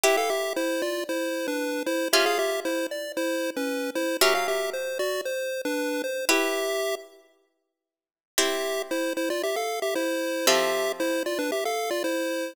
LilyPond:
<<
  \new Staff \with { instrumentName = "Lead 1 (square)" } { \time 4/4 \key c \major \tempo 4 = 115 <g' e''>16 <a' f''>16 <g' e''>8 <e' c''>8 <f' d''>8 <e' c''>8. <d' b'>8. <e' c''>8 | <g' e''>16 <aes' f''>16 <g' e''>8 <e' c''>8 d''8 <e' c''>8. <des' b'>8. <e' c''>8 | <g' e''>16 f''16 <g' e''>8 c''8 <fis' d''>8 c''8. <d' b'>8. c''8 | <g' e''>4. r2 r8 |
<g' e''>4 <e' c''>8 <e' c''>16 <f' d''>16 <g' e''>16 <a' f''>8 <g' e''>16 <e' c''>4 | <g' e''>4 <e' c''>8 <f' d''>16 <d' b'>16 <g' e''>16 <a' f''>8 <f' d''>16 <e' c''>4 | }
  \new Staff \with { instrumentName = "Harpsichord" } { \time 4/4 \key c \major <e' g' b'>1 | <des' f' aes'>1 | <fis cis' ais'>1 | <e' g' b'>1 |
<c' e' g'>1 | <f c' a'>1 | }
>>